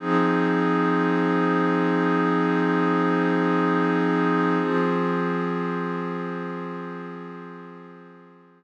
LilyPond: \new Staff { \time 4/4 \key f \phrygian \tempo 4 = 52 <f c' ees' aes'>1 | <f c' f' aes'>1 | }